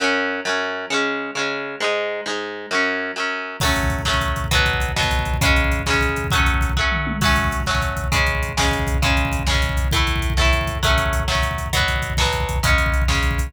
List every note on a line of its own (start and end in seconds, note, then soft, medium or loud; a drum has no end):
0.00 0.41 F#2 medium
0.00 0.41 F#3 medium
0.00 0.41 C#4 loud
0.45 0.86 F#2 medium
0.45 0.86 F#3 medium
0.45 0.86 C#4 medium
0.90 1.31 C#3 medium
0.90 1.31 G#3 medium
0.90 1.31 C#4 loud
1.35 1.76 C#3 medium
1.35 1.76 G#3 medium
1.35 1.76 C#4 medium
1.80 2.21 G#2 medium
1.80 2.21 G#3 medium
1.80 2.21 D#4 medium
2.26 2.66 G#2 medium
2.26 2.66 G#3 medium
2.26 2.66 D#4 medium
2.71 3.11 F#2 medium
2.71 3.11 F#3 medium
2.71 3.11 C#4 medium
3.16 3.57 F#2 medium
3.16 3.57 F#3 medium
3.16 3.57 C#4 medium
3.60 4.02 F#3 loud
3.60 4.02 A3 loud
3.60 kick medium
3.60 crash medium
3.65 4.02 C#4 medium
3.65 kick medium
3.76 kick medium
3.76 closed hi-hat medium
3.83 kick medium
3.90 kick medium
3.90 closed hi-hat medium
3.99 kick medium
4.05 4.46 F#3 medium
4.05 4.46 A3 medium
4.05 kick medium
4.05 snare loud
4.10 4.46 C#4 medium
4.14 kick medium
4.21 kick medium
4.21 closed hi-hat medium
4.28 kick medium
4.36 kick medium
4.36 closed hi-hat medium
4.44 kick medium
4.51 4.92 B2 loud
4.51 4.92 F#3 loud
4.51 4.92 B3 loud
4.51 kick medium
4.51 closed hi-hat medium
4.59 kick medium
4.66 kick medium
4.66 closed hi-hat medium
4.73 kick medium
4.80 kick medium
4.80 closed hi-hat medium
4.89 kick medium
4.96 5.37 B2 medium
4.96 5.37 F#3 medium
4.96 5.37 B3 loud
4.96 kick medium
4.96 snare loud
5.03 kick medium
5.11 kick medium
5.11 closed hi-hat medium
5.19 kick medium
5.25 kick medium
5.25 closed hi-hat medium
5.34 kick medium
5.41 5.82 C#3 medium
5.41 5.82 G#3 loud
5.41 5.82 C#4 loud
5.41 kick loud
5.41 closed hi-hat loud
5.49 kick medium
5.56 kick medium
5.56 closed hi-hat medium
5.64 kick medium
5.72 kick medium
5.72 closed hi-hat medium
5.79 kick medium
5.86 6.27 C#3 medium
5.86 6.27 G#3 medium
5.86 kick medium
5.86 snare loud
5.90 6.27 C#4 medium
5.90 kick medium
6.01 kick medium
6.01 closed hi-hat medium
6.09 kick medium
6.16 kick medium
6.16 closed hi-hat medium
6.24 kick medium
6.31 6.72 F#3 medium
6.31 6.72 A3 medium
6.31 kick loud
6.31 closed hi-hat medium
6.35 6.72 C#4 medium
6.40 kick medium
6.46 kick medium
6.46 closed hi-hat medium
6.54 kick medium
6.61 kick medium
6.61 closed hi-hat medium
6.69 kick medium
6.76 7.17 F#3 medium
6.76 7.17 A3 medium
6.76 kick medium
6.76 floor tom medium
6.81 7.17 C#4 medium
6.92 mid tom medium
7.07 high tom medium
7.21 7.62 F#3 loud
7.21 7.62 A3 loud
7.21 kick medium
7.21 crash medium
7.25 7.62 C#4 loud
7.25 kick medium
7.36 kick medium
7.36 closed hi-hat medium
7.44 kick medium
7.51 kick medium
7.51 closed hi-hat medium
7.60 kick medium
7.66 8.08 F#3 medium
7.66 8.08 A3 medium
7.66 kick medium
7.66 snare medium
7.71 8.08 C#4 medium
7.75 kick medium
7.82 kick medium
7.82 closed hi-hat medium
7.89 kick medium
7.97 kick medium
7.97 closed hi-hat medium
8.04 kick medium
8.12 8.53 C#3 loud
8.12 8.53 G#3 medium
8.12 8.53 C#4 loud
8.12 kick medium
8.12 closed hi-hat medium
8.19 kick medium
8.26 kick medium
8.26 closed hi-hat medium
8.35 kick medium
8.42 kick medium
8.42 closed hi-hat medium
8.49 kick medium
8.57 8.98 C#3 medium
8.57 8.98 G#3 medium
8.57 8.98 C#4 medium
8.57 kick medium
8.57 snare loud
8.65 kick medium
8.71 kick medium
8.71 closed hi-hat medium
8.79 kick medium
8.87 kick medium
8.87 closed hi-hat medium
8.94 kick medium
9.02 9.43 C#3 loud
9.02 9.43 G#3 loud
9.02 9.43 C#4 medium
9.02 kick medium
9.02 closed hi-hat medium
9.10 kick medium
9.17 kick medium
9.17 closed hi-hat medium
9.25 kick medium
9.32 kick medium
9.32 closed hi-hat medium
9.39 kick medium
9.47 9.88 C#3 medium
9.47 9.88 G#3 medium
9.47 kick medium
9.47 snare loud
9.51 9.88 C#4 medium
9.51 kick medium
9.62 kick medium
9.62 closed hi-hat medium
9.69 kick medium
9.77 kick medium
9.77 closed hi-hat medium
9.84 kick medium
9.91 10.33 A2 loud
9.91 10.33 A3 loud
9.91 kick medium
9.91 closed hi-hat medium
9.96 10.33 E4 medium
9.96 kick medium
10.07 kick medium
10.07 closed hi-hat medium
10.16 kick medium
10.22 kick medium
10.22 closed hi-hat medium
10.30 kick medium
10.37 10.78 A2 medium
10.37 10.78 A3 medium
10.37 kick medium
10.37 snare medium
10.41 10.78 E4 medium
10.41 kick medium
10.53 kick medium
10.53 closed hi-hat medium
10.61 kick medium
10.67 kick medium
10.67 closed hi-hat medium
10.75 kick medium
10.83 11.23 F#3 loud
10.83 11.23 A3 loud
10.83 11.23 C#4 loud
10.83 kick medium
10.83 closed hi-hat medium
10.90 kick medium
10.98 kick medium
10.98 closed hi-hat medium
11.06 kick medium
11.13 kick medium
11.13 closed hi-hat medium
11.20 kick medium
11.28 11.68 F#3 medium
11.28 11.68 A3 medium
11.28 11.68 C#4 medium
11.28 kick medium
11.28 snare loud
11.35 kick medium
11.43 kick medium
11.43 closed hi-hat medium
11.51 kick medium
11.58 kick medium
11.58 closed hi-hat medium
11.66 kick medium
11.73 12.14 B2 medium
11.73 12.14 F#3 loud
11.73 12.14 B3 loud
11.73 kick medium
11.73 closed hi-hat loud
11.80 kick medium
11.88 kick medium
11.88 closed hi-hat medium
11.96 kick medium
12.02 kick medium
12.02 closed hi-hat medium
12.10 kick medium
12.17 12.59 B2 medium
12.17 12.59 F#3 medium
12.17 kick medium
12.17 snare loud
12.22 12.59 B3 medium
12.22 kick medium
12.33 kick medium
12.33 closed hi-hat medium
12.40 kick medium
12.49 kick medium
12.49 closed hi-hat medium
12.56 kick medium
12.63 13.04 C#3 loud
12.63 13.04 G#3 loud
12.63 13.04 C#4 loud
12.63 kick loud
12.63 closed hi-hat loud
12.70 kick medium
12.78 kick medium
12.78 closed hi-hat medium
12.86 kick medium
12.92 kick medium
12.92 closed hi-hat medium
13.02 kick medium
13.08 13.49 C#3 medium
13.08 13.49 G#3 medium
13.08 13.49 C#4 medium
13.08 kick medium
13.08 snare medium
13.15 kick medium
13.23 kick medium
13.23 closed hi-hat medium
13.31 kick medium
13.38 kick medium
13.38 closed hi-hat medium
13.47 kick medium